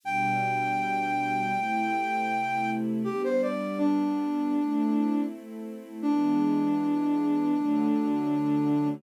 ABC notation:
X:1
M:4/4
L:1/16
Q:1/4=80
K:Ador
V:1 name="Flute"
g16 | G c d2 D8 z4 | D16 |]
V:2 name="String Ensemble 1"
[B,,G,D]8 [C,A,E]8 | [G,B,D]8 [A,CE]8 | [E,^G,B,D]8 [D,F,A,]8 |]